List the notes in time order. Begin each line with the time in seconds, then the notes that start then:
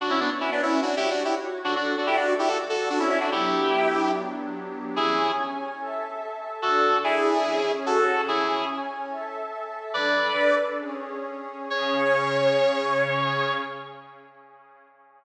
0.00 D4 F#4 C#5 F#5
0.10 C#4 E4
0.20 B3 D4
0.40 C#4 E4
0.52 B3 D4
0.62 C#4 E4
0.82 D4 F#4
0.97 E4 G4
1.10 D4 F#4
1.25 E4 G4
1.64 D4 F#4 A4 D5
1.76 D4 F#4
1.97 D4 F#4
2.07 E4 G4
2.16 D4 F#4
2.39 E4 G4
2.48 F#4 A4
2.69 F#4 A4
2.90 D4 F#4
2.99 C#4 E4
3.09 C#4 E4
3.20 D4 F#4
3.31 F#3 B3 D4 E4 G4
4.96 C#4 E4 G#4 C#5 G#5
5.79 A4 E5 A5
6.62 D4 F#4 A4 D5
7.04 E4 G#4
7.45 C#4 G#4 C#5
7.86 F#4 A4
8.28 C#4 E4 G#4 C#5 G#5
9.10 A4 E5 A5
9.93 D4 A4 B4 D5
10.78 C#4 G#4 C#5
11.70 C#3 C#4 G#4 C#5